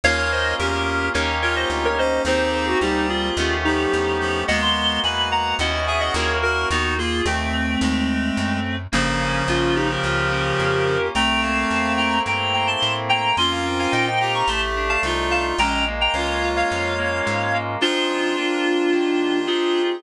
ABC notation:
X:1
M:4/4
L:1/16
Q:1/4=108
K:Ebmix
V:1 name="Clarinet"
[df]2 [ce]2 [GB]4 [Bd]2 [Bd] [ce] z [Bd] [ce]2 | [Ac]2 [Ac] ^F [EG]2 [=FA]4 [EG]6 | [e_g] c'3 [a_c']2 [gb]2 [eg]2 [_fa] [eg] [Bd]2 [_GB]2 | [E_G] [EG] [FA]2 [=A,C]12 |
[B,D]4 [DF]2 [EG] [GB]9 | [gb]2 [f=a]4 [gb]2 [gb]2 [gb] [ac']2 z [gb]2 | [ac'] [fa] z [fa] [eg] [eg] [gb] [bd'] [=ac'] z2 [fa] z2 [fa] z | [gb]2 z [gb] [df]3 [df]9 |
[K:Bbmix] [DF]12 [FA]4 |]
V:2 name="Clarinet"
[Bd]4 D4 z2 F4 D2 | [CE]4 G,4 z2 F,4 F,2 | [A,_C]4 _c4 z2 A4 B2 | _C2 B,2 =C4 A,6 z2 |
[D,F,]16 | [=A,C]8 z8 | [DF]6 G6 F4 | D2 z2 F6 z6 |
[K:Bbmix] [DF]16 |]
V:3 name="Electric Piano 2"
[B,DFA]8 [B,DEG]8 | [B,CGA]8 [=A,=B,^CG]8 | [A,B,_C_G]8 [CD_FG]4 [B,DFG]4 | z16 |
B,2 D2 F2 G2 F2 D2 B,2 D2 | =A,2 B,2 C2 =E2 C2 B,2 A,2 B,2 | B,2 C2 E2 F2 =A,2 =D2 E2 F2 | A,2 B,2 D2 F2 D2 B,2 A,2 B,2 |
[K:Bbmix] [F,CEA]4 [B,CDF]4 [E,B,DG]4 [CEGA]4 |]
V:4 name="Electric Bass (finger)" clef=bass
E,,4 =E,,4 _E,,4 =D,,4 | E,,4 =D,,4 E,,4 =E,,4 | E,,4 =E,,4 _E,,4 E,,4 | E,,4 E,,4 E,,4 _G,,4 |
G,,,4 B,,,4 D,,4 F,,4 | C,,4 =E,,4 G,,4 =A,,4 | F,,4 B,,4 =A,,,4 C,,4 | B,,,4 D,,4 F,,4 A,,4 |
[K:Bbmix] z16 |]